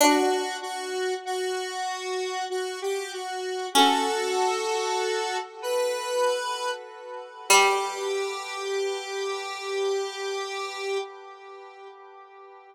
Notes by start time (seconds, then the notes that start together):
0.01 D4 F#4
0.62 F#4
1.25 F#4
2.50 F#4
2.82 G4
3.12 F#4
3.75 C#4 F#4 A4
5.62 B4
7.49 G3 G4